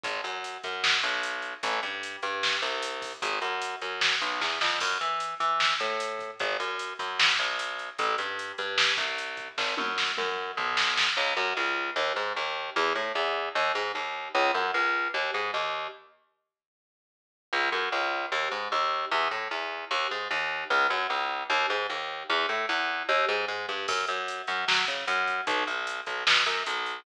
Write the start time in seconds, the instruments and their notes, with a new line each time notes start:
0.03 electric bass (finger) G#1, kick, closed hi-hat
0.24 electric bass (finger) F#2, closed hi-hat
0.44 closed hi-hat
0.63 electric bass (finger) F#2, kick, closed hi-hat
0.84 snare
1.03 electric bass (finger) B1, closed hi-hat
1.23 closed hi-hat
1.42 closed hi-hat
1.63 electric bass (finger) A1, kick, closed hi-hat
1.83 electric bass (finger) G2, closed hi-hat
2.03 closed hi-hat
2.22 electric bass (finger) G2, closed hi-hat
2.43 snare
2.62 electric bass (finger) C2, kick, closed hi-hat
2.82 closed hi-hat
3.02 kick, open hi-hat
3.22 electric bass (finger) G#1, kick, closed hi-hat
3.42 electric bass (finger) F#2, closed hi-hat
3.62 closed hi-hat
3.81 electric bass (finger) F#2, closed hi-hat
4.01 snare
4.21 electric bass (finger) B1, closed hi-hat
4.41 electric bass (finger) E2, kick, snare
4.61 electric bass (finger) F2, snare
4.80 electric bass (finger) F#2, kick, crash
5.01 electric bass (finger) E3, closed hi-hat
5.20 closed hi-hat
5.40 electric bass (finger) E3, closed hi-hat
5.60 snare
5.80 electric bass (finger) A2, closed hi-hat
6.00 closed hi-hat
6.19 kick, closed hi-hat
6.39 electric bass (finger) G#1, kick, closed hi-hat
6.60 electric bass (finger) F#2, closed hi-hat
6.79 closed hi-hat
6.99 electric bass (finger) F#2, kick, closed hi-hat
7.19 snare
7.39 electric bass (finger) B1, closed hi-hat
7.59 closed hi-hat
7.79 closed hi-hat
7.98 electric bass (finger) A1, kick, closed hi-hat
8.18 electric bass (finger) G2, closed hi-hat
8.39 closed hi-hat
8.58 electric bass (finger) G2, closed hi-hat
8.78 snare
8.97 electric bass (finger) C2, kick, closed hi-hat
9.18 closed hi-hat
9.37 kick, closed hi-hat
9.58 electric bass (finger) G#1, kick, snare
9.77 electric bass (finger) F#2, high tom
9.98 snare
10.17 electric bass (finger) F#2, mid tom
10.57 electric bass (finger) B1, floor tom
10.77 snare
10.97 snare
11.17 electric bass (finger) C#2
11.37 electric bass (finger) F#2
11.57 electric bass (finger) C#2
11.96 electric bass (finger) D#2
12.16 electric bass (finger) G#2
12.36 electric bass (finger) D#2
12.76 electric bass (finger) E2
12.95 electric bass (finger) A2
13.15 electric bass (finger) E2
13.55 electric bass (finger) D#2
13.75 electric bass (finger) G#2
13.95 electric bass (finger) D#2
14.35 electric bass (finger) C#2
14.54 electric bass (finger) F#2
14.74 electric bass (finger) C#2
15.14 electric bass (finger) D#2
15.34 electric bass (finger) G#2
15.54 electric bass (finger) D#2
17.53 electric bass (finger) C#2
17.72 electric bass (finger) F#2
17.92 electric bass (finger) C#2
18.32 electric bass (finger) D#2
18.51 electric bass (finger) G#2
18.72 electric bass (finger) D#2
19.11 electric bass (finger) E2
19.31 electric bass (finger) A2
19.51 electric bass (finger) E2
19.91 electric bass (finger) D#2
20.11 electric bass (finger) G#2
20.31 electric bass (finger) D#2
20.70 electric bass (finger) C#2
20.90 electric bass (finger) F#2
21.10 electric bass (finger) C#2
21.50 electric bass (finger) D#2
21.70 electric bass (finger) G#2
21.90 electric bass (finger) D#2
22.29 electric bass (finger) E2
22.49 electric bass (finger) A2
22.69 electric bass (finger) E2
23.09 electric bass (finger) D#2
23.29 electric bass (finger) G#2
23.48 electric bass (finger) G#2
23.69 electric bass (finger) G2
23.88 electric bass (finger) F#2, kick, crash
24.07 electric bass (finger) F#2, closed hi-hat
24.28 closed hi-hat
24.47 electric bass (finger) F#2, closed hi-hat
24.68 electric bass (finger) F#3, snare
24.87 electric bass (finger) C#3, closed hi-hat
25.07 electric bass (finger) F#2, closed hi-hat
25.27 kick, closed hi-hat
25.47 electric bass (finger) B1, kick, closed hi-hat
25.67 electric bass (finger) B1, closed hi-hat
25.87 closed hi-hat
26.06 electric bass (finger) B1, kick, closed hi-hat
26.27 electric bass (finger) B2, snare
26.46 electric bass (finger) F#2, closed hi-hat
26.66 electric bass (finger) B1, closed hi-hat
26.86 closed hi-hat